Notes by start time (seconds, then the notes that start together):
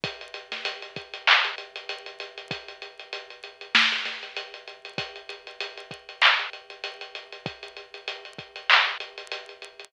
0.04 kick, closed hi-hat
0.21 closed hi-hat
0.34 closed hi-hat
0.52 snare, closed hi-hat
0.65 closed hi-hat
0.82 closed hi-hat
0.96 kick, closed hi-hat
1.14 closed hi-hat
1.27 clap
1.45 closed hi-hat
1.58 closed hi-hat
1.76 closed hi-hat
1.89 closed hi-hat
2.06 closed hi-hat
2.20 closed hi-hat
2.38 closed hi-hat
2.51 kick, closed hi-hat
2.68 closed hi-hat
2.82 closed hi-hat
2.99 closed hi-hat
3.13 closed hi-hat
3.30 closed hi-hat
3.44 closed hi-hat
3.61 closed hi-hat
3.75 snare
3.92 closed hi-hat
4.05 snare, closed hi-hat
4.23 closed hi-hat
4.36 closed hi-hat
4.54 closed hi-hat
4.68 closed hi-hat
4.85 closed hi-hat
4.98 kick, closed hi-hat
5.16 closed hi-hat
5.29 closed hi-hat
5.47 closed hi-hat
5.60 closed hi-hat
5.77 closed hi-hat
5.91 kick, closed hi-hat
6.09 closed hi-hat
6.22 clap
6.39 closed hi-hat
6.53 closed hi-hat
6.70 closed hi-hat
6.84 closed hi-hat
7.01 closed hi-hat
7.15 closed hi-hat
7.32 closed hi-hat
7.46 kick, closed hi-hat
7.63 closed hi-hat
7.77 closed hi-hat
7.94 closed hi-hat
8.08 closed hi-hat
8.25 closed hi-hat
8.38 kick, closed hi-hat
8.56 closed hi-hat
8.70 clap
8.87 closed hi-hat
9.00 closed hi-hat
9.18 closed hi-hat
9.32 closed hi-hat
9.49 closed hi-hat
9.62 closed hi-hat
9.80 closed hi-hat